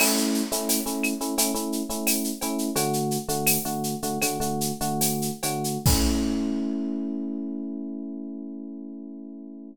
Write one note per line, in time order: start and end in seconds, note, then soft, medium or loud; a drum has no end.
0.00 0.42 A3 loud
0.00 0.42 C#4 loud
0.00 0.42 E4 loud
0.00 crash loud
0.00 cowbell medium
0.00 claves loud
0.17 shaker medium
0.34 shaker medium
0.52 0.79 A3 loud
0.52 0.79 C#4 medium
0.52 0.79 E4 loud
0.52 shaker loud
0.69 tambourine medium
0.69 cowbell medium
0.69 shaker loud
0.86 1.14 A3 medium
0.86 1.14 C#4 medium
0.86 1.14 E4 medium
0.86 shaker medium
1.03 claves loud
1.03 shaker medium
1.21 1.34 A3 medium
1.21 1.34 C#4 medium
1.21 1.34 E4 medium
1.21 shaker medium
1.38 1.52 A3 loud
1.38 1.52 C#4 loud
1.38 1.52 E4 medium
1.38 cowbell medium
1.38 shaker loud
1.54 1.82 A3 medium
1.54 1.82 C#4 medium
1.54 1.82 E4 loud
1.54 shaker medium
1.72 shaker medium
1.90 2.31 A3 medium
1.90 2.31 C#4 medium
1.90 2.31 E4 medium
1.90 shaker medium
2.07 tambourine medium
2.07 cowbell medium
2.07 claves medium
2.07 shaker loud
2.24 shaker medium
2.41 2.70 A3 medium
2.41 2.70 C#4 medium
2.41 2.70 E4 loud
2.41 cowbell medium
2.41 shaker medium
2.58 shaker medium
2.76 3.18 D3 loud
2.76 3.18 A3 loud
2.76 3.18 F#4 loud
2.76 cowbell loud
2.76 shaker loud
2.93 shaker medium
3.11 shaker medium
3.28 3.57 D3 medium
3.28 3.57 A3 loud
3.28 3.57 F#4 medium
3.28 shaker medium
3.47 tambourine loud
3.47 cowbell medium
3.47 claves loud
3.47 shaker loud
3.65 3.95 D3 medium
3.65 3.95 A3 medium
3.65 3.95 F#4 medium
3.65 shaker medium
3.84 shaker medium
4.02 4.18 D3 medium
4.02 4.18 A3 medium
4.02 4.18 F#4 medium
4.02 shaker medium
4.21 4.38 D3 medium
4.21 4.38 A3 medium
4.21 4.38 F#4 medium
4.21 cowbell medium
4.21 claves medium
4.21 shaker loud
4.40 4.72 D3 medium
4.40 4.72 A3 medium
4.40 4.72 F#4 medium
4.40 shaker medium
4.61 shaker loud
4.81 5.30 D3 medium
4.81 5.30 A3 loud
4.81 5.30 F#4 medium
4.81 shaker medium
5.01 tambourine medium
5.01 cowbell medium
5.01 shaker loud
5.22 shaker medium
5.43 5.78 D3 medium
5.43 5.78 A3 medium
5.43 5.78 F#4 medium
5.43 cowbell loud
5.43 shaker loud
5.64 shaker medium
5.86 9.70 A3 loud
5.86 9.70 C#4 loud
5.86 9.70 E4 medium
5.86 kick loud
5.86 crash loud